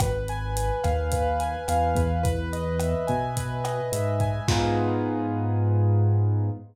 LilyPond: <<
  \new Staff \with { instrumentName = "Acoustic Grand Piano" } { \time 4/4 \key gis \minor \tempo 4 = 107 b'8 gis''8 b'8 eis''8 b'8 gis''8 eis''8 b'8 | b'8 dis''8 e''8 gis''8 b'8 dis''8 e''8 gis''8 | <b dis' eis' gis'>1 | }
  \new Staff \with { instrumentName = "Synth Bass 1" } { \clef bass \time 4/4 \key gis \minor gis,,4. dis,4. e,8 e,8~ | e,4. b,4. gis,4 | gis,1 | }
  \new DrumStaff \with { instrumentName = "Drums" } \drummode { \time 4/4 <hh bd ss>8 hh8 hh8 <hh bd ss>8 <hh bd>8 hh8 <hh ss>8 <hh bd>8 | <hh bd>8 hh8 <hh ss>8 <hh bd>8 <hh bd>8 <hh ss>8 hh8 <hh bd>8 | <cymc bd>4 r4 r4 r4 | }
>>